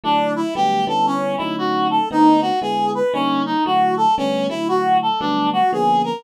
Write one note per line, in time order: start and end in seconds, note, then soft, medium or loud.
0.04 0.43 D3 loud
0.04 0.43 F#3 loud
0.04 0.43 A3 loud
0.04 0.33 D4 medium
0.04 0.43 E4 loud
0.36 0.54 E4 medium
0.55 0.85 D3 loud
0.55 0.85 F#3 loud
0.55 0.85 G3 medium
0.55 0.85 A3 loud
0.55 0.85 B3 loud
0.55 0.85 G4 medium
0.87 1.36 D3 loud
0.87 1.36 G3 loud
0.87 1.36 B3 loud
0.87 1.36 C#4 loud
0.87 1.36 E4 loud
0.87 1.06 A4 medium
1.06 1.36 C#4 medium
1.37 1.99 D3 loud
1.37 1.99 F#3 loud
1.37 1.99 A3 loud
1.37 1.99 C#4 loud
1.37 1.99 D#4 loud
1.37 1.56 E4 medium
1.58 1.87 F#4 medium
1.90 2.09 A4 medium
2.11 2.50 D3 loud
2.11 2.50 A3 loud
2.11 2.50 B3 loud
2.11 2.50 C4 loud
2.11 2.50 D#4 loud
2.11 2.41 D#4 medium
2.41 2.60 F#4 medium
2.62 3.01 D3 loud
2.62 3.01 G#3 loud
2.62 3.01 B3 loud
2.62 3.01 E4 loud
2.62 2.91 G#4 medium
2.95 3.13 B4 medium
3.13 3.53 D3 loud
3.13 3.53 G3 medium
3.13 3.53 A#3 loud
3.13 3.42 C#4 medium
3.13 3.53 C#4 loud
3.13 3.53 D#4 loud
3.46 3.64 D#4 medium
3.66 4.06 D3 loud
3.66 4.06 F#3 loud
3.66 4.06 A3 loud
3.66 4.06 E4 loud
3.66 3.95 F#4 medium
3.97 4.15 A4 medium
4.17 4.48 D3 loud
4.17 4.48 G3 loud
4.17 4.48 A3 loud
4.17 4.48 B3 loud
4.17 4.47 C#4 medium
4.17 4.48 C#4 loud
4.49 5.09 D3 loud
4.49 5.09 F#3 loud
4.49 5.09 A3 medium
4.49 4.68 E4 medium
4.49 5.09 E4 medium
4.68 4.98 F#4 medium
5.02 5.20 A4 medium
5.20 5.60 D3 loud
5.20 5.60 F#3 loud
5.20 5.60 G3 loud
5.20 5.60 A3 loud
5.20 5.60 B3 loud
5.20 5.49 D4 medium
5.53 5.71 F#4 medium
5.73 6.12 D3 loud
5.73 6.12 F3 loud
5.73 6.12 A#3 loud
5.73 6.12 B3 loud
5.73 6.12 C#4 medium
5.73 6.02 G#4 medium
6.04 6.23 A#4 medium